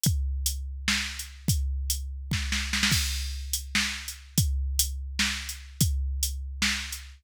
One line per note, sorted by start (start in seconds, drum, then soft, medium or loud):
0.04 kick loud
0.04 closed hi-hat loud
0.46 closed hi-hat loud
0.88 snare loud
1.19 closed hi-hat medium
1.48 kick loud
1.48 closed hi-hat loud
1.90 closed hi-hat loud
2.31 kick loud
2.31 snare medium
2.52 snare loud
2.73 snare loud
2.83 snare loud
2.92 kick loud
2.92 crash loud
3.53 closed hi-hat loud
3.75 snare loud
4.08 closed hi-hat medium
4.38 kick loud
4.38 closed hi-hat loud
4.79 closed hi-hat loud
5.19 snare loud
5.49 closed hi-hat medium
5.81 kick loud
5.81 closed hi-hat loud
6.23 closed hi-hat loud
6.62 snare loud
6.92 closed hi-hat medium